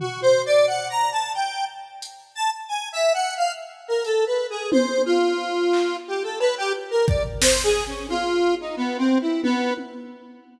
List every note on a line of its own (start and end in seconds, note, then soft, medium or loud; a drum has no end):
0.00 0.21 F#4 medium
0.00 floor tom medium
0.22 0.42 C5 loud
0.46 0.66 D5 loud
0.67 0.88 F#5 medium
0.90 1.10 A#5 medium
1.12 1.32 A5 medium
1.35 1.65 G5 medium
2.02 closed hi-hat medium
2.35 2.50 A5 medium
2.69 2.89 G#5 medium
2.92 3.13 E5 loud
3.14 3.34 F#5 medium
3.37 3.52 F5 medium
3.88 4.03 A#4 medium
4.04 4.25 A4 medium
4.04 closed hi-hat medium
4.26 4.47 B4 medium
4.50 4.70 G#4 medium
4.72 5.02 C5 medium
4.72 high tom loud
5.06 5.97 F4 loud
5.73 clap medium
6.08 6.23 G4 medium
6.23 6.39 A4 medium
6.40 6.55 B4 loud
6.40 cowbell medium
6.58 6.73 G4 loud
6.91 7.06 A#4 medium
7.08 7.23 D5 medium
7.08 kick loud
7.42 7.62 C5 medium
7.42 snare loud
7.64 7.84 G#4 loud
7.86 8.07 C#4 medium
8.09 8.55 F4 loud
8.09 high tom medium
8.61 8.76 D#4 medium
8.77 8.97 B3 medium
8.98 9.18 C4 medium
9.21 9.41 E4 medium
9.43 9.74 B3 loud
9.43 high tom medium
9.78 high tom medium